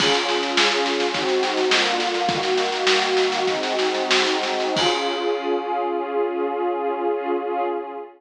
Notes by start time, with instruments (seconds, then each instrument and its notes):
0.00 pad 2 (warm) C#4 F4 G#4, kick, snare, crash
0.14 snare
0.29 snare
0.43 snare
0.57 snare
0.72 snare
0.86 snare
1.00 snare
1.14 pad 2 (warm) G#3 C4 D#4 F#4, kick, snare
1.29 snare
1.43 snare
1.57 snare
1.71 pad 2 (warm) D3 A#3 F4, snare
1.86 snare
2.00 snare
2.14 snare
2.29 pad 2 (warm) D#3 A#3 F#4, kick, snare
2.43 snare
2.58 snare
2.72 snare
2.87 snare
3.02 snare
3.17 snare
3.32 snare
3.47 pad 2 (warm) G#3 C4 D#4 F#4, kick, snare
3.63 snare
3.79 snare
3.95 snare
4.11 snare
4.27 snare
4.43 snare
4.60 snare
4.76 pad 2 (warm) C#4 F4 G#4, kick, crash